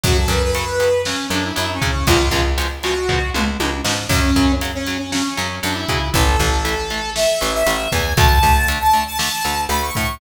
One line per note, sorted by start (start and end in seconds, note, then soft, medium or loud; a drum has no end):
0.03 0.26 F#2 medium
0.03 0.14 C#3 medium
0.03 0.14 F#3 medium
0.03 0.17 F#4 loud
0.03 kick medium
0.03 closed hi-hat medium
0.18 0.30 A4 medium
0.28 1.14 F#2 medium
0.28 0.40 C#3 medium
0.28 0.40 F#3 medium
0.28 0.42 B4 medium
0.28 kick medium
0.28 closed hi-hat medium
0.44 1.02 B4 medium
0.55 0.65 C#3 medium
0.55 0.65 F#3 medium
0.55 closed hi-hat medium
0.80 0.90 C#3 medium
0.80 0.90 F#3 medium
0.80 closed hi-hat medium
1.05 1.16 C#3 medium
1.05 1.16 F#3 medium
1.05 1.27 C#4 medium
1.05 snare medium
1.30 1.52 F#2 medium
1.30 1.41 C#3 medium
1.30 1.41 F#3 medium
1.30 1.44 D4 medium
1.30 closed hi-hat medium
1.44 1.54 E4 medium
1.55 1.79 F#2 medium
1.55 1.66 C#3 medium
1.55 1.66 F#3 medium
1.55 1.71 E4 medium
1.55 closed hi-hat medium
1.73 1.90 C#4 medium
1.82 1.92 C#3 medium
1.82 2.04 C#3 medium
1.82 1.92 F#3 medium
1.82 kick medium
1.82 closed hi-hat medium
1.90 2.06 C#4 loud
2.07 2.29 C#2 loud
2.07 2.17 B2 medium
2.07 2.17 C#3 medium
2.07 2.17 F3 medium
2.07 2.17 G#3 medium
2.07 2.41 F4 loud
2.07 kick medium
2.07 closed hi-hat medium
2.31 3.18 C#2 medium
2.31 2.42 B2 medium
2.31 2.42 C#3 medium
2.31 2.42 F3 medium
2.31 2.42 G#3 medium
2.31 kick medium
2.31 closed hi-hat medium
2.58 2.68 B2 medium
2.58 2.68 C#3 medium
2.58 2.68 F3 medium
2.58 2.68 G#3 medium
2.58 closed hi-hat medium
2.83 2.94 B2 medium
2.83 2.94 C#3 medium
2.83 2.94 F3 medium
2.83 2.94 G#3 medium
2.83 3.30 F#4 medium
2.83 closed hi-hat medium
3.09 3.19 B2 medium
3.09 3.19 C#3 medium
3.09 3.19 F3 medium
3.09 3.19 G#3 medium
3.09 kick medium
3.09 floor tom medium
3.34 3.57 C#2 medium
3.34 3.44 B2 medium
3.34 3.44 C#3 medium
3.34 3.44 F3 medium
3.34 3.44 G#3 medium
3.34 mid tom medium
3.60 3.81 C#2 medium
3.60 3.70 B2 medium
3.60 3.70 C#3 medium
3.60 3.70 F3 medium
3.60 3.70 G#3 medium
3.60 high tom medium
3.84 4.06 G#2 medium
3.84 3.95 B2 medium
3.84 3.95 C#3 medium
3.84 3.95 F3 medium
3.84 3.95 G#3 medium
3.84 snare loud
4.09 4.31 F#2 medium
4.09 4.20 C#3 medium
4.09 4.20 F#3 medium
4.09 4.52 C#4 loud
4.09 kick medium
4.09 crash medium
4.36 5.22 F#2 medium
4.36 4.46 C#3 medium
4.36 4.46 F#3 medium
4.36 kick medium
4.36 closed hi-hat medium
4.61 4.72 C#3 medium
4.61 4.72 F#3 medium
4.61 closed hi-hat medium
4.74 4.98 C#4 medium
4.87 4.97 C#3 medium
4.87 4.97 F#3 medium
4.87 closed hi-hat medium
4.99 5.11 C#4 medium
5.12 5.22 C#3 medium
5.12 5.22 F#3 medium
5.12 5.55 C#4 medium
5.12 snare medium
5.37 5.60 F#2 medium
5.37 5.47 C#3 medium
5.37 5.47 F#3 medium
5.37 closed hi-hat medium
5.63 5.85 F#2 medium
5.63 5.73 C#3 medium
5.63 5.73 F#3 medium
5.63 5.75 D4 medium
5.63 closed hi-hat medium
5.74 6.08 E4 medium
5.88 5.99 C#3 medium
5.88 6.11 C#3 medium
5.88 5.99 F#3 medium
5.88 kick medium
5.88 closed hi-hat medium
6.14 6.36 A1 loud
6.14 6.24 E3 medium
6.14 6.24 A3 medium
6.14 7.10 A4 loud
6.14 kick medium
6.14 closed hi-hat medium
6.39 7.26 A1 medium
6.39 6.50 E3 medium
6.39 6.50 A3 medium
6.39 kick medium
6.39 closed hi-hat medium
6.65 6.75 E3 medium
6.65 6.75 A3 medium
6.65 closed hi-hat medium
6.90 7.01 E3 medium
6.90 7.01 A3 medium
6.90 closed hi-hat medium
7.15 7.26 E3 medium
7.15 7.26 A3 medium
7.15 7.53 E5 medium
7.15 snare loud
7.41 7.63 A1 medium
7.41 7.51 E3 medium
7.41 7.51 A3 medium
7.41 closed hi-hat medium
7.54 7.90 E5 loud
7.66 7.88 A1 medium
7.66 7.76 E3 medium
7.66 7.76 A3 medium
7.66 closed hi-hat loud
7.92 8.14 E2 medium
7.92 8.03 E3 medium
7.92 8.03 A3 medium
7.92 8.13 G#5 medium
7.92 kick medium
7.92 closed hi-hat medium
8.17 8.39 D2 medium
8.17 8.27 D3 loud
8.17 8.27 A3 medium
8.17 8.67 A5 loud
8.17 kick loud
8.17 closed hi-hat medium
8.43 9.30 D2 medium
8.43 8.53 D3 medium
8.43 8.53 A3 medium
8.43 kick medium
8.43 closed hi-hat medium
8.68 8.78 D3 medium
8.68 8.78 A3 medium
8.68 closed hi-hat loud
8.80 9.01 A5 medium
8.93 9.03 D3 medium
8.93 9.03 A3 medium
8.93 closed hi-hat medium
9.07 9.17 A5 loud
9.18 9.29 D3 medium
9.18 9.29 A3 medium
9.18 9.61 A5 medium
9.18 snare loud
9.44 9.67 D2 medium
9.44 9.55 D3 medium
9.44 9.55 A3 medium
9.44 closed hi-hat medium
9.69 9.91 D2 medium
9.69 9.80 D3 medium
9.69 9.80 A3 medium
9.69 9.81 B5 medium
9.69 closed hi-hat medium
9.82 10.15 C#6 medium
9.95 10.18 A2 medium
9.95 10.06 D3 medium
9.95 10.06 A3 medium
9.95 kick medium
9.95 closed hi-hat medium